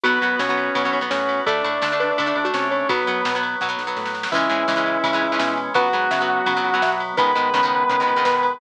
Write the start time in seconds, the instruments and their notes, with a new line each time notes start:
0.03 synth bass 1 B1, acoustic guitar (steel) F#3 B3, drawbar organ B3 F#4, distortion guitar B3 B4, xylophone F#4, ride
0.22 synth bass 1 F#2, acoustic guitar (steel) F#3 B3, ride
0.39 synth bass 1 B2, acoustic guitar (steel) F#3 B3, distortion guitar C#4 C#5, snare
0.49 acoustic guitar (steel) F#3 B3
0.57 ride
0.75 synth bass 1 B2, acoustic guitar (steel) F#3 B3, kick, ride
0.85 acoustic guitar (steel) F#3 B3
0.93 synth bass 1 B1, ride
1.01 acoustic guitar (steel) F#3 B3
1.10 synth bass 1 A2, distortion guitar C#4 C#5, snare
1.29 ride
1.46 synth bass 1 D2, drawbar organ A3 D4, acoustic guitar (steel) A3 D4, distortion guitar D4 D5, xylophone A4, kick, ride
1.64 synth bass 1 A2, acoustic guitar (steel) A3 D4, ride
1.82 synth bass 1 D3, acoustic guitar (steel) A3 D4, snare
1.92 acoustic guitar (steel) A3 D4
2.00 xylophone B4, ride
2.18 synth bass 1 D3, acoustic guitar (steel) A3 D4, kick, ride
2.26 acoustic guitar (steel) A3 D4
2.36 synth bass 1 D2, ride
2.44 acoustic guitar (steel) A3 D4, xylophone F#4
2.54 synth bass 1 C3, distortion guitar C#4 C#5, snare
2.71 xylophone C#5, ride
2.89 synth bass 1 B1, acoustic guitar (steel) F#3 B3, drawbar organ F#3 B3, distortion guitar B3 B4, xylophone F#4, kick, ride
3.07 synth bass 1 F#2, acoustic guitar (steel) F#3 B3, ride
3.25 synth bass 1 B2, acoustic guitar (steel) F#3 B3, snare
3.35 acoustic guitar (steel) F#3 B3
3.43 ride
3.61 synth bass 1 B2, acoustic guitar (steel) F#3 B3, xylophone B3, kick, snare
3.69 acoustic guitar (steel) F#3 B3
3.79 synth bass 1 B1, snare
3.87 acoustic guitar (steel) F#3 B3
3.97 synth bass 1 A2, snare
4.06 snare
4.14 snare
4.23 snare
4.32 synth bass 1 C#2, drawbar organ E3 G#3 C#4, xylophone E3, acoustic guitar (steel) E3 G#3, distortion guitar E4 E5, kick, crash
4.36 acoustic guitar (steel) C#4
4.49 synth bass 1 G#2, acoustic guitar (steel) E3 G#3 C#4, ride
4.68 synth bass 1 C#3, acoustic guitar (steel) E3 G#3 C#4, xylophone G#3, snare
4.76 acoustic guitar (steel) E3 G#3 C#4
4.86 ride
5.04 synth bass 1 C#3, acoustic guitar (steel) E3 G#3 C#4, kick, ride
5.13 acoustic guitar (steel) E3 G#3 C#4
5.22 synth bass 1 C#2, ride
5.32 acoustic guitar (steel) E3 G#3 C#4
5.39 synth bass 1 B2, xylophone C#4, snare
5.57 ride
5.74 synth bass 1 C#2, acoustic guitar (steel) F#3 B3, drawbar organ F#3 B3, distortion guitar F#4 F#5, xylophone B4, kick, ride
5.93 synth bass 1 G#2, acoustic guitar (steel) F#3 B3, ride
6.11 synth bass 1 C#3, acoustic guitar (steel) F#3 B3, xylophone E5, snare
6.21 acoustic guitar (steel) F#3 B3
6.46 synth bass 1 C#3, acoustic guitar (steel) F#3 B3, kick, ride
6.57 acoustic guitar (steel) F#3 B3
6.64 synth bass 1 C#2, ride
6.74 acoustic guitar (steel) F#3 B3
6.82 synth bass 1 B2, xylophone E5, snare
7.00 ride
7.17 synth bass 1 C#2, acoustic guitar (steel) D#3 G#3 B3, drawbar organ D#3 G#3 B3, xylophone B4, distortion guitar B4 B5, kick, ride
7.35 synth bass 1 G#2, acoustic guitar (steel) D#3 G#3 B3, ride
7.54 synth bass 1 C#3, acoustic guitar (steel) D#3 G#3 B3, snare
7.63 acoustic guitar (steel) D#3 G#3 B3
7.89 synth bass 1 C#3, acoustic guitar (steel) D#3 G#3 B3, kick, ride
8.00 acoustic guitar (steel) D#3 G#3 B3
8.07 synth bass 1 C#2, ride
8.16 acoustic guitar (steel) D#3 G#3 B3
8.25 synth bass 1 B2, xylophone B4, snare
8.43 ride